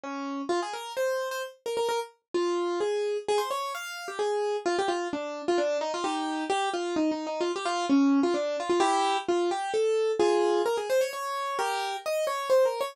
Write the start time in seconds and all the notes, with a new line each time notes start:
0.04 C#4
0.49 F4
0.62 G#4
0.73 A#4
0.97 C5
1.31 C5
1.66 A#4
1.77 A#4
1.89 A#4
2.34 F4
2.80 G#4
3.28 G#4
3.38 C5
3.51 C#5
3.75 F5
4.08 G4
4.19 G#4
4.66 F4
4.79 G4
4.88 F4
5.13 D4
5.48 F4
5.58 D4
5.81 D#4
5.94 F4
6.04 D#4 G4
6.50 G4
6.74 F4
6.96 D#4
7.11 D#4
7.27 D#4
7.41 F4
7.56 G4
7.65 F4
7.90 C#4
8.23 F4
8.34 D4
8.60 F4
8.70 F4
8.80 E4 G4
9.28 F4
9.51 G4
9.74 A4
10.20 F4 G#4
10.66 A#4
10.77 G#4
10.90 C5
11.01 C#5
11.13 C#5
11.59 G4 A#4
12.06 D#5
12.27 C#5
12.50 C5
12.65 A#4
12.81 C#5